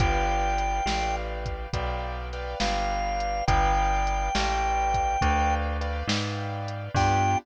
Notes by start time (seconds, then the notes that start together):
0.00 G1 B4 D5 F5 G5, kick, closed hi-hat
0.58 closed hi-hat
0.86 A1 B4 D5 F5 G5, snare
1.46 kick, closed hi-hat
1.73 B1 B4 D5 F5 G5, kick, closed hi-hat
2.33 B4 D5 F5 G5, closed hi-hat
2.60 G1 B4 D5 F5 G5, snare
3.20 closed hi-hat
3.47 G1 B4 D5 F5 G5, kick, closed hi-hat
4.07 closed hi-hat
4.35 A1 B4 D5 F5 G5, snare
4.94 kick, closed hi-hat
5.21 D2 B4 D5 F5 G5, kick, closed hi-hat
5.81 B4 D5 F5 G5, closed hi-hat
6.07 G#2 B4 D5 F5 G5, snare
6.68 closed hi-hat
6.94 G2 B3 D4 F4 G4 G5, kick, crash